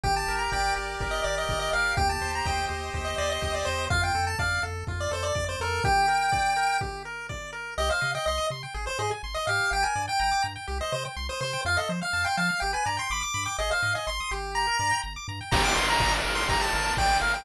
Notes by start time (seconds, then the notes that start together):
0.04 G1 G4 G5, kick
0.16 A5
0.28 G1 A#4
0.39 A#5
0.52 G1 D5 G5, kick
0.76 G1 G4
1.00 G1 A#4, kick
1.11 D#5
1.24 G1 D5
1.38 D#5
1.49 G1 G4, kick
1.59 D#5
1.73 G1 A#4 F5
1.97 D#2 G4 G5, kick
2.09 A5
2.21 D#2 C5
2.35 A#5
2.45 D#2 D#5 G5, kick
2.69 D#2 G4
2.94 D#2 C5, kick
3.05 D#5
3.18 D#2 D5 D#5
3.30 D#5
3.41 D#2 G4, kick
3.55 D5
3.65 E2 C5
3.90 F2 F4 F5, kick
4.03 G5
4.15 F2 A4
4.27 A5
4.39 F2 D5 F5, kick
4.63 F2 A4
4.87 F2 F4, kick
5.01 D5
5.11 F2 A4 C5
5.23 D5
5.35 F2 D5, kick
5.49 C5
5.60 F2 A4 A#4
5.84 G4 G5, kick
6.08 A#4
6.32 D5, kick
6.56 A#4
6.81 G4, kick
7.05 A#4
7.29 D5, kick
7.53 A#4
7.78 C2 G4 D#5
7.90 C5 F5
8.01 C3 D#5
8.15 D#5 G5
8.26 C2 D#5 C6
8.38 D#6
8.50 C3 C6
8.63 G5
8.74 G#1 G#4
8.86 C5
8.99 G#2 G#4 D#5
9.11 G#5
9.23 G#1 C6
9.34 D#5 D#6
9.47 G#2 G4 F5
9.71 G1 G5
9.83 A#4 G#5
9.96 G2 D5
10.08 G5
10.19 G1 G5 A#5
10.31 D6
10.43 G2 A#5
10.56 G5
10.67 C2 G4
10.81 C5 D#5
10.92 C3 C5 D#5
11.05 G5
11.17 C2 C6
11.29 C5 D#6
11.41 C3 C5 C6
11.53 G5
11.65 F2 F4 F5
11.77 A4 D#5
11.89 F3 C5
12.02 F5
12.13 F2 A5
12.25 G5 C6
12.37 F3 F5 A5
12.49 F5
12.60 G1 G4 G5
12.73 B4 G#5
12.85 G2 D5 A#5
12.97 G5 C6
13.10 G1 B5 D6
13.21 D6
13.34 G2 B5
13.45 G5 D6
13.58 G#1 G#4 D#5
13.71 C5 F5
13.82 G#2 D#5
13.95 D#5 G#5
14.07 G#1 C6
14.20 D#6
14.31 G1 G4
14.55 A#5
14.67 A#4
14.79 G2 D5
14.91 G5
15.03 G1 A#5
15.16 D6
15.28 G2 A#5
15.41 G5
15.51 G1 G4 A#5, kick, crash
15.64 D6
15.75 G1 A#4 C6
15.90 A#5
15.99 G1 D5, kick
16.24 G1 A#4
16.35 C6
16.49 G1 G4 A#5, kick
16.61 A5
16.73 G1 A#4
16.97 A1 D5 G5, kick
17.21 G1 A#4 F5
17.34 G5